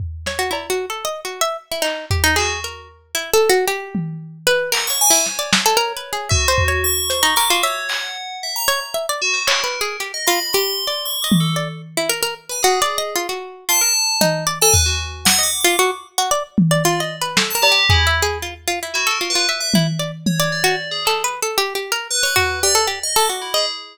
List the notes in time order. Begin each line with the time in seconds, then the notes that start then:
0.00 floor tom
0.26 C#5, snare
0.39 F#4
0.51 E4, cowbell
0.70 F#4
0.90 A4
1.05 D#5
1.25 F#4
1.41 E5
1.71 E4
1.82 D#4, clap
2.11 G4, floor tom
2.24 D#4
2.36 F#4 G#4, clap
2.64 A#4
3.15 E4
3.34 A4
3.49 F#4
3.68 G4
3.95 high tom
4.47 B4
4.72 A#4 F#5, clap
4.87 C#5 C#6
5.01 G#5
5.11 E4 C5
5.26 C#5, snare
5.39 D5
5.53 snare
5.66 A4
5.77 A#4
5.97 B4
6.13 G#4
6.29 F#4 E5, kick
6.48 C5
6.58 floor tom
6.68 C#5
6.84 C#6
7.10 C5, closed hi-hat
7.23 D#4
7.36 A#4 D6, clap
7.50 F4 F#4
7.63 C#5 E5
7.89 F#5, clap
8.43 E5
8.56 A#5
8.68 C#5
8.94 E5
9.09 D5
9.21 F#4
9.34 C5
9.47 A#4 C#5, clap
9.64 B4
9.81 G#4
10.00 G4, closed hi-hat
10.14 D#5
10.27 F4 B5
10.53 G4 C6
10.87 D5
11.05 C#6
11.22 D#5 D6
11.32 high tom
11.40 A4
11.56 D5
11.97 E4
12.09 A#4
12.23 A#4
12.49 B4 G#5
12.63 F#4 G#4, closed hi-hat
12.82 D5
12.98 D#5
13.16 F4
13.29 F#4
13.69 F4 A5
13.81 A#4
14.21 D#4, high tom
14.47 D5
14.61 A4 G#5
14.73 B4, floor tom
14.86 F#4
15.25 F#5, snare
15.39 D#5
15.43 D6
15.61 F4 D6
15.79 F#4
16.18 F#4
16.31 D5
16.58 high tom
16.71 D5
16.84 F4 D5
17.00 D#5
17.21 B4
17.37 A4, snare
17.50 A5
17.55 A#4
17.62 G4, cowbell
17.72 G4
17.89 E4 G#4, floor tom
18.07 E5
18.22 G#4
18.42 F4
18.68 F4
18.83 E4
18.94 E4 F#4
19.07 A4
19.11 A#4
19.21 F4
19.30 B4
19.35 F4
19.49 E5
19.61 E5
19.74 E4, high tom
19.99 D5
20.26 C#5, high tom
20.40 D5
20.52 D5
20.64 F#4
20.91 G#4
21.05 A4, clap
21.24 B4
21.42 A4
21.58 G4
21.75 G4
21.92 A#4
22.10 B4
22.23 C#5 B5
22.36 F#4 B4, floor tom
22.63 G4 D5
22.75 A4
22.87 G4
23.03 D#5
23.16 A4 D6
23.29 F#4
23.42 E4
23.54 G#4 D#5